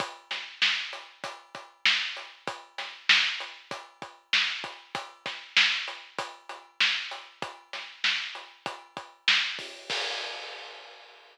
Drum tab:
CC |--------|--------|--------|--------|
HH |xx-xxx-x|xx-xxx-x|xx-xxx-x|xx-xxx-o|
SD |-oo---o-|-oo---o-|-oo---o-|-oo---o-|
BD |o---oo--|o---oo-o|oo--o---|o---oo-o|

CC |x-------|
HH |--------|
SD |--------|
BD |o-------|